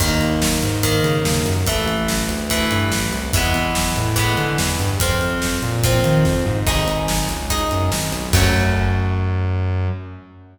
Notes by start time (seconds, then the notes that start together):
0.00 D#2 D#3 A#3, kick, crash
0.21 D#2, closed hi-hat
0.42 snare
0.62 G#2, closed hi-hat
0.83 D#3 A#3, kick, closed hi-hat
1.04 C#3, closed hi-hat
1.25 D#2, snare
1.46 F#2, closed hi-hat
1.66 A1 E3 A3, kick, closed hi-hat
1.87 A1, closed hi-hat
2.08 snare
2.29 D2, closed hi-hat
2.50 E3 A3, kick, closed hi-hat
2.71 G2, closed hi-hat
2.92 A1, snare
3.12 C2, closed hi-hat
3.33 E2 E3 G#3, kick, closed hi-hat
3.37 B3
3.54 E2, closed hi-hat
3.75 snare
3.96 A2, closed hi-hat
4.16 E3 G#3 B3, kick, closed hi-hat
4.37 D3, closed hi-hat
4.58 E2, snare
4.79 G2, closed hi-hat
5.00 F2 F3 C4, kick, closed hi-hat
5.21 F2, closed hi-hat
5.42 snare
5.62 A#2, closed hi-hat
5.83 F3 C4, kick, closed hi-hat
6.04 D#3, closed hi-hat
6.25 F2, kick, snare
6.46 G#2, mid tom
6.67 G#1 D#4 G#4, kick, crash
6.87 G#1, closed hi-hat
7.08 snare
7.29 C#2, closed hi-hat
7.50 D#4 G#4, kick, closed hi-hat
7.71 F#2, closed hi-hat
7.92 G#1, snare
8.12 B1, closed hi-hat
8.33 F#2 F#3 A3 C#4, kick, crash